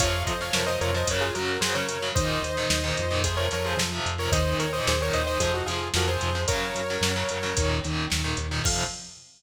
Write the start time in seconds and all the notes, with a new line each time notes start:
0.00 F2 C3 F3 C#5 F5, kick, closed hi-hat
0.26 F2 C5 D#5, kick, closed hi-hat
0.41 C3 F3 C#5 F5
0.53 F2 A#4 C#5, snare
0.66 C3 F3 C5 D#5
0.81 F2 A#4 C#5, closed hi-hat
0.94 C3 F3 C5 D#5
1.07 F#2 C#3 F#3 A#4 C#5, kick, closed hi-hat
1.21 F4 G#4
1.34 F#2 C#3 F#3 F#4 A#4, closed hi-hat
1.60 F#2 C#3 F#3 G#4 C5, snare
1.74 C#3 F#3 A#4 C#5
1.89 F#2, closed hi-hat
2.02 C#3 F#3
2.15 D#2 A#2 D#3 C5 D#5, kick, closed hi-hat
2.42 D#2, closed hi-hat
2.57 A#2 D#3
2.70 D#2, snare
2.84 A#2 D#3
2.97 F2, closed hi-hat
3.11 A#2 D#3
3.24 C3 F3 G#4 C5, kick, closed hi-hat
3.37 A#4 C#5
3.51 F2 C3 F3 A#4 C#5, closed hi-hat
3.66 G#4 C5
3.77 F2 C3 F3, snare
3.92 C3 F3
4.06 F2, closed hi-hat
4.18 C3 F3 A#4 C#5
4.32 D#2 A#2 D#3 C5 D#5, kick, closed hi-hat
4.59 D#2 A#4 C#5, closed hi-hat
4.73 A#2 D#3 C5 D#5
4.87 D#2 G#4 C5, snare
5.00 A#2 D#3 A#4 C#5
5.13 D#2 C5 D#5, closed hi-hat
5.27 A#2 D#3 C5 D#5
5.40 F2 C3 F3 G#4 C5, kick, closed hi-hat
5.54 D#4 F#4
5.66 F2 C3 F3 F4 G#4, closed hi-hat
5.94 F2 C3 F3 F#4 A#4, snare
6.08 C3 F3 G#4 C5
6.21 F2, closed hi-hat
6.35 C3 F3
6.48 F#2 C#3 F#3 A#4 C#5, kick, closed hi-hat
6.75 F#2, closed hi-hat
6.90 C#3 F#3
7.01 F#2, snare
7.16 C#3 F#3
7.29 F#2, closed hi-hat
7.43 C#3 F#3
7.57 D#2 A#2 D#3, kick, closed hi-hat
7.84 D#2 A#2 D#3, closed hi-hat
8.10 D#2 A#2 D#3, snare
8.24 A#2 D#3
8.37 D#2, closed hi-hat
8.51 A#2 D#3
8.64 F2 C3 F3 F5, kick, crash